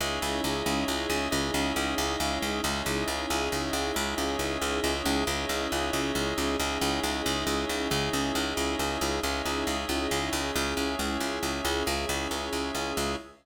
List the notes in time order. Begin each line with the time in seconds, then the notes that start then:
0.00 C#2 C#4 D#4 E4 G#4 C#5 D#5 E5
0.22 C#2
0.44 C#2
0.66 C#2
0.88 C#2
1.10 C#2
1.31 C#2 C#4 D#4 E4 G#4 C#5 D#5 E5
1.54 C#2
1.76 C#2
1.98 C#2
2.20 C#2
2.42 C#2
2.63 C#2 C#4 D#4 E4 G#4 C#5 D#5 E5
2.86 C#2
3.08 C#2
3.30 C#2
3.52 C#2
3.73 C#2
3.94 C#2 C#4 D#4 E4 G#4 C#5 D#5 E5
4.18 C#2
4.39 C#2
4.62 C#2
4.84 C#2
5.05 C#2
5.27 C#2 C#4 D#4 E4 G#4 C#5 D#5 E5
5.49 C#2
5.72 C#2
5.93 C#2
6.15 C#2
6.38 C#2
6.59 C#2 C#4 D#4 E4 G#4 C#5 D#5 E5
6.81 C#2
7.03 C#2
7.26 C#2
7.47 C#2
7.69 C#2
7.90 C#2 C#4 D#4 E4 G#4 C#5 D#5 E5
8.13 C#2
8.35 C#2
8.57 C#2
8.79 C#2
9.01 C#2
9.23 C#2 C#4 D#4 E4 G#4 C#5 D#5 E5
9.45 C#2
9.67 C#2
9.89 C#2
10.11 C#2
10.33 C#2
10.54 C#2 C#4 E4 G#4 C#5 E5
10.77 C#2
10.99 C#2
11.20 C#2
11.43 C#2
11.65 C#2
11.86 C#2 C#4 E4 G#4 C#5 E5
12.09 C#2
12.31 C#2
12.53 C#2
12.75 C#2
12.97 C#2